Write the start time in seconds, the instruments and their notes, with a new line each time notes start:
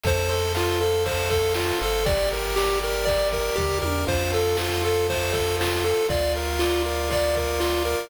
0.03 synth bass 1 F2, lead 1 (square) A4 C5, kick, ride
0.28 lead 1 (square) A4 C5, ride
0.54 lead 1 (square) F4 F5, snare
0.80 lead 1 (square) A4 C5, ride
1.06 lead 1 (square) A4 C5, kick, ride
1.30 lead 1 (square) A4 C5, kick, ride
1.54 lead 1 (square) F4 F5, snare
1.80 synth bass 1 G1, lead 1 (square) A4 C5, ride
2.05 lead 1 (square) G4 D5, kick, ride
2.30 lead 1 (square) A#4, ride
2.56 lead 1 (square) G4 D5, snare
2.81 lead 1 (square) A#4, ride
3.05 lead 1 (square) G4 D5, kick, ride
3.32 lead 1 (square) A#4, kick, ride
3.56 synth bass 1 D#2, lead 1 (square) G4 D5, kick, floor tom
3.82 synth bass 1 E2, lead 1 (square) A#4, high tom
4.07 synth bass 1 F2, lead 1 (square) F4 C5, kick, crash
4.32 lead 1 (square) A4, ride
4.57 lead 1 (square) F4 C5, snare
4.83 lead 1 (square) A4, ride
5.07 lead 1 (square) F4 C5, kick, ride
5.33 lead 1 (square) A4, kick, ride
5.59 lead 1 (square) F4 C5, snare
5.83 lead 1 (square) A4, ride
6.08 synth bass 1 D2, lead 1 (square) F4 D5, kick, ride
6.35 lead 1 (square) A#4, ride
6.59 lead 1 (square) F4 D5, snare
6.85 lead 1 (square) A#4, ride
7.10 lead 1 (square) F4 D5, kick, ride
7.35 lead 1 (square) A#4, kick, ride
7.59 lead 1 (square) F4 D5, snare
7.85 lead 1 (square) A#4, ride